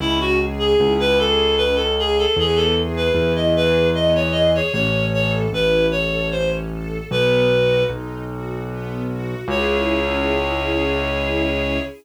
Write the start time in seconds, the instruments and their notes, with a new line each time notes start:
0.00 acoustic grand piano C#2, string ensemble 1 C#4, clarinet E4
0.20 clarinet F#4
0.39 string ensemble 1 G#4
0.59 clarinet G#4
0.79 acoustic grand piano C#2, string ensemble 1 E4
1.00 clarinet B4
1.18 string ensemble 1 G#4, clarinet A4
1.57 string ensemble 1 C#4, clarinet B4
1.75 clarinet A4
1.98 string ensemble 1 G#4, clarinet G#4
2.18 clarinet A4
2.37 acoustic grand piano E2, string ensemble 1 B3, clarinet G#4
2.56 clarinet A4
2.76 string ensemble 1 G#4
2.96 clarinet B4
3.14 acoustic grand piano E2, string ensemble 1 E4
3.36 clarinet D#5
3.55 string ensemble 1 G#4, clarinet B4
3.94 string ensemble 1 B3, clarinet D#5
4.15 clarinet C#5
4.32 string ensemble 1 G#4, clarinet D#5
4.55 clarinet C#5
4.73 acoustic grand piano A1, string ensemble 1 C#4, clarinet C#5
5.13 string ensemble 1 A4, clarinet C#5
5.53 acoustic grand piano A1, string ensemble 1 E4, clarinet B4
5.91 string ensemble 1 A4, clarinet C#5
6.32 string ensemble 1 C#4, clarinet C5
6.70 string ensemble 1 A4
7.10 acoustic grand piano B1, string ensemble 1 B3, clarinet B4
7.50 string ensemble 1 F#4
7.89 acoustic grand piano B1, string ensemble 1 D#4
8.29 string ensemble 1 F#4
8.68 string ensemble 1 B3
9.08 string ensemble 1 F#4
9.48 acoustic grand piano C#2, string ensemble 1 C#4 E4 G#4, clarinet C#5